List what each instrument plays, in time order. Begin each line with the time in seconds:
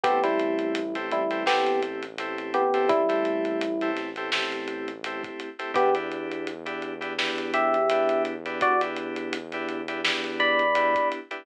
0.03 synth bass 1 A1, electric piano 2 A3 C4 E4 G4, electric piano 1 B3 G4, kick, closed hi-hat
0.24 electric piano 1 G3 E4, electric piano 2 A3 C4 E4 G4, closed hi-hat
0.39 closed hi-hat
0.59 closed hi-hat
0.75 closed hi-hat
0.95 electric piano 2 A3 C4 E4 G4, closed hi-hat
1.11 electric piano 1 G3 E4, closed hi-hat
1.30 electric piano 2 A3 C4 E4 G4, closed hi-hat
1.46 electric piano 2 A3 C4 E4 G4, electric piano 1 B3 G4, snare
1.66 closed hi-hat
1.82 closed hi-hat
2.03 closed hi-hat
2.18 electric piano 2 A3 C4 E4 G4, closed hi-hat
2.38 closed hi-hat
2.54 electric piano 1 B3 G4, closed hi-hat
2.74 electric piano 2 A3 C4 E4 G4, closed hi-hat
2.89 electric piano 1 G3 E4, kick, closed hi-hat
3.09 electric piano 2 A3 C4 E4 G4, closed hi-hat
3.25 closed hi-hat
3.45 closed hi-hat
3.61 closed hi-hat
3.81 electric piano 2 A3 C4 E4 G4, closed hi-hat
3.97 snare, closed hi-hat
4.16 electric piano 2 A3 C4 E4 G4, closed hi-hat
4.32 electric piano 2 A3 C4 E4 G4, snare
4.52 closed hi-hat
4.68 closed hi-hat
4.88 closed hi-hat
5.04 electric piano 2 A3 C4 E4 G4, closed hi-hat
5.24 kick, closed hi-hat
5.40 closed hi-hat
5.59 electric piano 2 A3 C4 E4 G4, closed hi-hat
5.74 synth bass 1 E2, electric piano 2 B3 D4 E4 G4, electric piano 1 B3 G4, kick, closed hi-hat
5.94 electric piano 2 B3 D4 E4 G4, closed hi-hat
6.11 closed hi-hat
6.31 closed hi-hat
6.47 closed hi-hat
6.66 electric piano 2 B3 D4 E4 G4, closed hi-hat
6.82 closed hi-hat
7.01 electric piano 2 B3 D4 E4 G4, closed hi-hat
7.18 electric piano 2 B3 D4 E4 G4, snare
7.38 closed hi-hat
7.54 electric piano 1 G4 E5, closed hi-hat
7.74 closed hi-hat
7.90 electric piano 2 B3 D4 E4 G4, closed hi-hat
8.09 closed hi-hat
8.25 closed hi-hat
8.46 electric piano 2 B3 D4 E4 G4, closed hi-hat
8.61 electric piano 1 F#4 D5, kick, closed hi-hat
8.81 electric piano 2 B3 D4 E4 G4, closed hi-hat
8.96 closed hi-hat
9.16 closed hi-hat
9.33 closed hi-hat
9.52 electric piano 2 B3 D4 E4 G4, closed hi-hat
9.69 closed hi-hat
9.88 electric piano 2 B3 D4 E4 G4, closed hi-hat
10.04 electric piano 2 B3 D4 E4 G4, snare
10.24 closed hi-hat
10.40 electric piano 1 D5 B5, closed hi-hat
10.59 closed hi-hat
10.75 electric piano 2 B3 D4 E4 G4, closed hi-hat
10.95 kick, closed hi-hat
11.12 closed hi-hat
11.31 electric piano 2 B3 D4 E4 G4, closed hi-hat